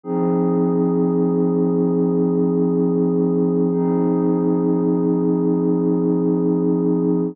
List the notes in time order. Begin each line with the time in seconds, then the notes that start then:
0.03 F3 C4 D#4 G#4
3.70 F3 C4 D#4 G#4